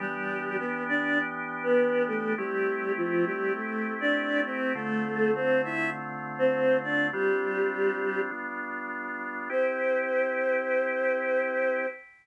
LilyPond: <<
  \new Staff \with { instrumentName = "Choir Aahs" } { \time 4/4 \key c \major \tempo 4 = 101 <g g'>4 <b b'>8 <d' d''>8 r8. <b b'>8. <a a'>8 | <g g'>4 <f f'>8 <g g'>8 <a a'>8. <d' d''>8. <c' c''>8 | <a a'>4 <c' c''>8 <e' e''>8 r8. <c' c''>8. <d' d''>8 | <g g'>2 r2 |
c''1 | }
  \new Staff \with { instrumentName = "Drawbar Organ" } { \time 4/4 \key c \major <e b d' g'>1 | <a c' e' g'>1 | <d a c' f'>1 | <g c' d' f'>2 <g b d' f'>2 |
<c' e' g'>1 | }
>>